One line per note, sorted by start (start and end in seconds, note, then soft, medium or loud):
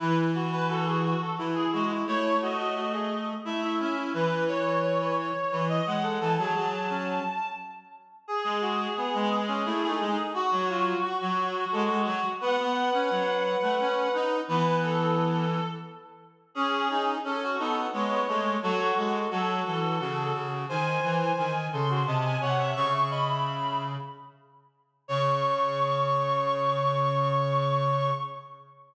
0.00 1.14 E3 loud
0.00 0.31 E4 medium
0.00 0.16 B4 medium
0.35 0.51 F#4 medium
0.52 0.68 F#4 medium
0.52 0.68 B4 medium
0.69 0.85 F#4 medium
0.69 0.85 A4 medium
0.86 1.03 F#4 medium
0.86 1.03 G#4 medium
1.04 1.20 F#4 medium
1.21 1.38 A4 medium
1.38 1.66 E3 medium
1.38 1.55 E4 medium
1.54 1.84 E4 medium
1.54 1.71 G#4 medium
1.72 2.04 G#3 medium
1.72 1.89 F#4 medium
1.90 2.06 E4 medium
2.06 3.33 A3 loud
2.06 2.35 E4 medium
2.06 2.37 C#5 medium
2.42 2.58 F#4 medium
2.42 3.25 D#5 medium
2.59 2.75 F#4 medium
2.76 2.92 F#4 medium
2.93 3.09 G#4 medium
3.45 3.78 A3 medium
3.45 3.61 E4 medium
3.45 3.73 E5 medium
3.63 3.94 E4 medium
3.79 4.13 C#4 medium
3.79 4.09 E5 medium
3.97 4.13 E4 medium
4.14 5.31 E3 loud
4.14 4.44 B4 medium
4.14 4.48 B4 medium
4.48 5.15 C#5 medium
4.48 4.64 C#5 medium
4.65 4.82 C#5 medium
4.83 4.99 C#5 medium
5.01 5.17 B4 medium
5.18 5.60 C#5 medium
5.51 5.80 E3 loud
5.51 5.68 B4 medium
5.69 5.98 D#5 medium
5.69 5.85 D#5 medium
5.86 6.18 G#3 medium
5.86 6.14 F#5 medium
6.03 6.19 A4 medium
6.20 6.37 E3 loud
6.20 6.37 A4 medium
6.20 7.46 A5 medium
6.38 6.54 F#3 loud
6.38 6.54 G#4 medium
6.55 7.19 F#3 loud
6.55 6.88 G#4 medium
6.90 7.23 C#4 medium
8.28 10.19 G#4 medium
8.28 8.58 G#4 medium
8.44 8.87 G#3 loud
8.61 8.93 F#4 medium
8.97 9.40 B3 medium
9.14 9.63 G#3 loud
9.48 9.64 C#4 medium
9.66 9.82 A3 loud
9.66 9.87 E4 medium
9.83 9.99 A3 loud
9.89 10.11 D#4 medium
10.00 10.17 G#3 loud
10.11 10.33 D#4 medium
10.34 12.29 F#4 medium
10.34 10.51 F#4 medium
10.52 10.94 F#3 loud
10.52 10.68 F#4 medium
10.70 10.99 F4 medium
11.04 11.65 F#4 medium
11.21 11.65 F#3 loud
11.72 11.89 G#3 loud
11.72 12.01 A4 medium
11.90 12.06 G#3 loud
12.06 12.23 F#3 loud
12.41 12.58 B3 loud
12.41 14.37 B4 medium
12.41 14.13 F#5 medium
12.58 12.90 B3 loud
12.93 13.09 C#4 loud
13.10 13.56 F#3 loud
13.62 13.79 A3 loud
13.80 14.08 C#4 loud
14.14 14.41 D#4 loud
14.48 15.59 E3 loud
14.48 15.46 B3 medium
14.48 14.82 B4 medium
14.83 15.66 A4 medium
16.55 17.15 C#4 medium
16.55 16.88 C#4 loud
16.55 17.04 G#4 medium
16.90 17.18 D#4 loud
17.24 17.55 C#4 loud
17.24 17.56 C#4 medium
17.24 17.41 A4 medium
17.42 17.59 F#4 medium
17.58 17.87 B3 loud
17.58 17.88 D#4 medium
17.58 17.74 A4 medium
17.93 18.22 G#3 loud
17.93 18.10 B3 medium
17.93 18.53 C#5 medium
18.11 18.27 B3 medium
18.28 18.57 G#3 loud
18.28 18.55 A3 medium
18.62 18.92 F#3 loud
18.62 18.96 F#4 loud
18.62 18.78 A4 medium
18.79 19.30 A4 medium
18.97 19.26 G#3 medium
18.97 19.13 F#4 medium
19.30 19.62 F#3 loud
19.30 19.97 F#4 medium
19.30 19.63 A4 medium
19.66 19.99 E3 medium
19.66 20.31 A4 medium
20.00 20.32 C#3 loud
20.00 20.65 F#4 medium
20.34 20.66 C#3 medium
20.69 20.98 D#3 loud
20.69 21.53 C5 medium
20.69 21.11 G#5 medium
21.03 21.32 E3 loud
21.20 21.65 G#5 medium
21.38 21.68 D#3 loud
21.72 22.03 C#3 loud
21.72 21.89 A4 medium
21.72 22.03 C6 medium
21.90 22.06 F#4 medium
22.06 22.36 C3 loud
22.06 22.41 D#5 medium
22.06 22.23 A5 medium
22.24 22.40 G#5 medium
22.41 22.74 C3 loud
22.41 22.71 C#5 medium
22.41 22.58 F#5 medium
22.59 22.75 E5 medium
22.75 23.95 C#3 loud
22.75 22.93 C#5 medium
22.75 23.09 C#6 loud
22.93 23.10 E5 medium
23.10 23.28 D#5 medium
23.10 23.78 B5 medium
23.30 23.84 E5 medium
25.08 28.11 C#3 loud
25.08 28.10 C#5 loud
25.08 28.11 C#6 loud